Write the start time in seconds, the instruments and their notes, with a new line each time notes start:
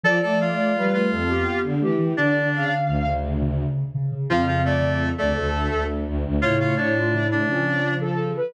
0.03 ocarina F3 D5, violin F3, clarinet A4 A5
0.22 violin A3, clarinet A4 A5
0.41 clarinet F4 F5
0.75 violin G3, ocarina B4
0.93 ocarina A3, clarinet F4 F5
1.11 violin F2, ocarina A4
1.29 ocarina B3 G4
1.63 violin D3
1.81 violin E3, ocarina A3 G4
1.98 ocarina E3
2.17 violin D3, ocarina D3 D5, clarinet D4 D5
2.53 violin C#3, ocarina F5
2.87 violin D2
3.05 ocarina C#3
3.41 ocarina C#3
3.94 ocarina C#3
4.12 ocarina C#3
4.30 violin F2, ocarina C#3 F5, clarinet F3 F4
4.47 clarinet F3 F4
4.65 clarinet A3 A4, ocarina D5
4.81 ocarina C#3
5.18 violin D2, clarinet A3 A4, ocarina D5
5.36 violin D2, ocarina A4
5.71 violin D2
6.06 violin D2
6.25 violin D2
6.42 violin A2, ocarina C#3 C#5, clarinet F4 F5
6.60 clarinet F4 F5
6.77 clarinet D4 D5
6.95 ocarina F4
7.13 ocarina C#3 E4
7.31 clarinet D4 D5
7.47 ocarina C#3 C#4, violin F3
8.01 ocarina A4
8.36 ocarina B4